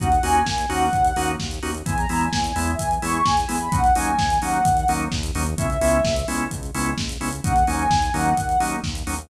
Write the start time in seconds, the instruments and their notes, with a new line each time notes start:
0.00 synth bass 1 D#2, drawbar organ A#3 C#4 D#4 F#4, ocarina F#5, kick, closed hi-hat
0.12 closed hi-hat
0.23 synth bass 1 D#2, drawbar organ A#3 C#4 D#4 F#4, ocarina G#5, open hi-hat
0.35 closed hi-hat
0.46 synth bass 1 D#2, kick, snare
0.58 closed hi-hat
0.69 synth bass 1 D#2, drawbar organ A#3 C#4 D#4 F#4, ocarina F#5, open hi-hat
0.93 synth bass 1 D#2, kick, closed hi-hat
1.04 closed hi-hat
1.16 synth bass 1 D#2, drawbar organ A#3 C#4 D#4 F#4, open hi-hat
1.28 closed hi-hat
1.40 synth bass 1 D#2, kick, snare
1.51 closed hi-hat
1.62 synth bass 1 D#2, drawbar organ A#3 C#4 D#4 F#4, open hi-hat
1.75 closed hi-hat
1.86 synth bass 1 E2, drawbar organ G#3 B3 E4, ocarina G#5, kick, closed hi-hat
1.98 ocarina A#5, closed hi-hat
2.09 synth bass 1 E2, drawbar organ G#3 B3 E4, open hi-hat
2.21 ocarina G#5, closed hi-hat
2.33 synth bass 1 E2, kick, snare
2.44 ocarina G#5, closed hi-hat
2.56 synth bass 1 E2, drawbar organ G#3 B3 E4, open hi-hat
2.67 ocarina E5, closed hi-hat
2.79 synth bass 1 E2, ocarina G#5, kick, closed hi-hat
2.91 closed hi-hat
3.02 synth bass 1 E2, drawbar organ G#3 B3 E4, ocarina C#6, open hi-hat
3.14 closed hi-hat
3.25 synth bass 1 E2, ocarina G#5, kick, snare
3.37 closed hi-hat
3.48 synth bass 1 E2, drawbar organ G#3 B3 E4, open hi-hat
3.60 ocarina B5, closed hi-hat
3.72 synth bass 1 D#2, drawbar organ F#3 A#3 C#4 D#4, ocarina F#5, kick, closed hi-hat
3.84 closed hi-hat
3.95 synth bass 1 D#2, drawbar organ F#3 A#3 C#4 D#4, ocarina G#5, open hi-hat
4.07 closed hi-hat
4.19 synth bass 1 D#2, kick, snare
4.30 closed hi-hat
4.42 synth bass 1 D#2, drawbar organ F#3 A#3 C#4 D#4, ocarina F#5, open hi-hat
4.54 closed hi-hat
4.65 synth bass 1 D#2, kick, closed hi-hat
4.77 closed hi-hat
4.88 synth bass 1 D#2, drawbar organ F#3 A#3 C#4 D#4, open hi-hat
5.00 closed hi-hat
5.12 synth bass 1 D#2, kick, snare
5.23 closed hi-hat
5.35 synth bass 1 D#2, drawbar organ F#3 A#3 C#4 D#4, open hi-hat
5.46 closed hi-hat
5.58 synth bass 1 C#2, drawbar organ G#3 B3 C#4 E4, ocarina E5, kick, closed hi-hat
5.70 closed hi-hat
5.81 synth bass 1 C#2, drawbar organ G#3 B3 C#4 E4, open hi-hat
5.93 closed hi-hat
6.04 synth bass 1 C#2, kick, snare
6.16 closed hi-hat
6.28 synth bass 1 C#2, drawbar organ G#3 B3 C#4 E4, open hi-hat
6.40 closed hi-hat
6.51 synth bass 1 C#2, kick, closed hi-hat
6.63 closed hi-hat
6.74 synth bass 1 C#2, drawbar organ G#3 B3 C#4 E4, open hi-hat
6.86 closed hi-hat
6.98 synth bass 1 C#2, kick, snare
7.09 closed hi-hat
7.21 synth bass 1 C#2, drawbar organ G#3 B3 C#4 E4, open hi-hat
7.33 closed hi-hat
7.44 synth bass 1 D#2, drawbar organ F#3 A#3 C#4 D#4, ocarina F#5, kick, closed hi-hat
7.56 closed hi-hat
7.67 synth bass 1 D#2, drawbar organ F#3 A#3 C#4 D#4, ocarina G#5, open hi-hat
7.79 closed hi-hat
7.90 synth bass 1 D#2, kick, snare
8.02 closed hi-hat
8.14 synth bass 1 D#2, drawbar organ F#3 A#3 C#4 D#4, ocarina F#5, open hi-hat
8.26 closed hi-hat
8.37 synth bass 1 D#2, kick, closed hi-hat
8.49 closed hi-hat
8.60 synth bass 1 D#2, drawbar organ F#3 A#3 C#4 D#4, open hi-hat
8.72 closed hi-hat
8.84 synth bass 1 D#2, kick, snare
8.95 closed hi-hat
9.07 synth bass 1 D#2, drawbar organ F#3 A#3 C#4 D#4, open hi-hat
9.19 closed hi-hat